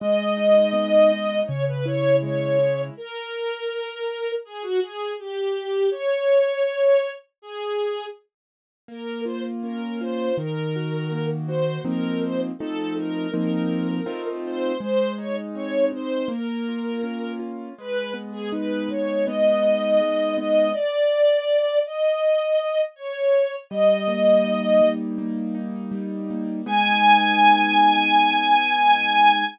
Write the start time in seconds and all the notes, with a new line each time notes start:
0.00 G#3 D#5
0.37 D#4
0.73 B3
1.12 D#4
1.47 C#3 C#5
1.68 B4
1.85 E4 C#5
2.22 G#3 C#5
2.59 E4
2.97 A#4
4.45 G#4
4.63 F#4
4.82 G#4
5.19 G4
5.91 C#5
7.42 G#4
8.88 A#3 A#4
9.25 F4 C5
9.63 C#4 A#4
10.00 F4 C5
10.37 D#3 A#4
10.76 F#4
11.12 A#3
11.47 F#4 C5
11.85 F3 A#3 C4 D#4 A#4
12.23 C5
12.59 F3 A3 C4 D#4 A4
12.97 A#4
13.32 F3 A#3 C4 D#4 A#4
14.06 A3 C4 D#4 F4
14.46 C5
14.80 G#3 C5
15.18 D#4 C#5
15.54 C4 C#5
15.92 D#4 C5
16.28 A#3 A#4
16.69 F4
17.03 C#4
17.39 F4
17.78 G#3 B4
18.14 B3
18.32 G#4
18.52 D#4 B4
18.89 G#3 C#5
19.26 B3 D#5
19.62 D#4
20.01 G#3
20.37 B3 D#5
20.73 D5
21.86 D#5
22.96 C#5
23.70 G3 D#5
24.08 A#3
24.44 D#4
24.81 G3
25.18 A#3
25.55 D#4
25.92 G3
26.30 A#3
26.66 G#3 B3 D#4 G#5